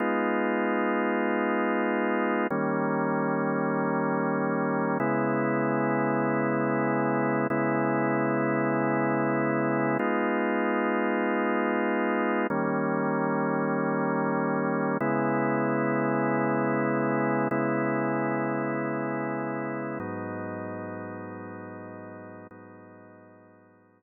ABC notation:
X:1
M:4/4
L:1/8
Q:1/4=96
K:G#m
V:1 name="Drawbar Organ"
[G,B,D^E]8 | [D,=G,A,C]8 | [C,G,B,E]8 | [C,G,B,E]8 |
[G,B,D^E]8 | [D,=G,A,C]8 | [C,G,B,E]8 | [C,G,B,E]8 |
[G,,F,B,D]8 | [G,,F,B,D]8 |]